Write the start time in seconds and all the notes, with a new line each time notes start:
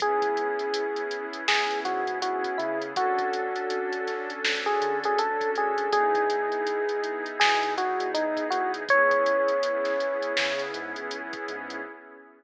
0.00 C#2 B3 C#4 E4 G#4, kick, closed hi-hat
0.22 C#2, kick, closed hi-hat
0.37 closed hi-hat
0.59 closed hi-hat
0.74 closed hi-hat
0.96 closed hi-hat
1.11 closed hi-hat
1.33 closed hi-hat
1.48 C#2 G#4, snare
1.70 closed hi-hat
1.85 G#2 F#4, closed hi-hat
2.07 G#2, closed hi-hat
2.22 F#4, closed hi-hat
2.44 kick, closed hi-hat
2.58 C#3 E4, closed hi-hat
2.82 closed hi-hat
2.96 D2 C#4 D4 F#4 A4, kick, closed hi-hat
3.18 D2, kick, closed hi-hat
3.33 closed hi-hat
3.56 closed hi-hat
3.70 closed hi-hat
3.93 closed hi-hat
4.07 snare, closed hi-hat
4.30 closed hi-hat
4.44 D2, snare
4.66 G#4, closed hi-hat
4.81 D3, closed hi-hat
5.04 D2 G#4, closed hi-hat
5.19 A4, closed hi-hat
5.41 kick, closed hi-hat
5.55 D2 G#4, closed hi-hat
5.78 closed hi-hat
5.92 E2 B3 D#4 E4 G#4, kick, closed hi-hat
6.15 E2, kick, closed hi-hat
6.30 closed hi-hat
6.52 closed hi-hat
6.67 closed hi-hat
6.89 closed hi-hat
7.04 closed hi-hat
7.26 closed hi-hat
7.40 B2 G#4, snare
7.63 closed hi-hat
7.77 E2 F#4, closed hi-hat
8.00 E2, closed hi-hat
8.14 D#4, closed hi-hat
8.37 kick, closed hi-hat
8.50 E2 F#4, closed hi-hat
8.74 closed hi-hat
8.89 C#2 B3 C#4 E4 G#4 C#5, kick, closed hi-hat
9.11 C#2, kick, closed hi-hat
9.26 closed hi-hat
9.48 closed hi-hat
9.63 closed hi-hat
9.85 snare, closed hi-hat
10.00 closed hi-hat
10.22 closed hi-hat
10.37 C#3, snare
10.59 closed hi-hat
10.74 G#2, closed hi-hat
10.96 C#2, closed hi-hat
11.11 closed hi-hat
11.33 kick, closed hi-hat
11.48 G#2, closed hi-hat
11.70 closed hi-hat